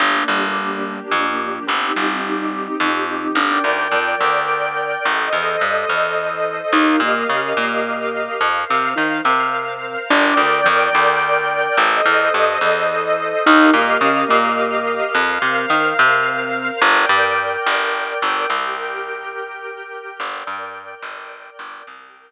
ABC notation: X:1
M:3/4
L:1/8
Q:1/4=107
K:Gm
V:1 name="Acoustic Grand Piano"
D G,3 F,2 | C G,3 F,2 | D D, F, D,3 | z =E, G, E,3 |
E B, _D B,3 | z C E C3 | D D, F, D,3 | z =E, G, E,3 |
E B, _D B,3 | z C E C3 | z6 | z6 |
z6 | z6 |]
V:2 name="Electric Bass (finger)" clef=bass
G,,, G,,,3 F,,2 | G,,, G,,,3 F,,2 | G,,, D,, F,, D,,3 | A,,, =E,, G,, E,,3 |
E,, B,, _D, B,,3 | F,, C, E, C,3 | G,,, D,, F,, D,,3 | A,,, =E,, G,, E,,3 |
E,, B,, _D, B,,3 | F,, C, E, C,3 | G,,, G,,2 G,,,2 G,,, | C,,6 |
G,,, G,,2 G,,,2 G,,, | C,,6 |]
V:3 name="String Ensemble 1"
[B,DG]6 | [CEG]6 | [Bdg]6 | [Ace]6 |
[GBef]6 | [Bcf]6 | [Bdg]6 | [Ace]6 |
[GBef]6 | [Bcf]6 | [Bdg]6 | [GBg]6 |
[Bdg]6 | [GBg]6 |]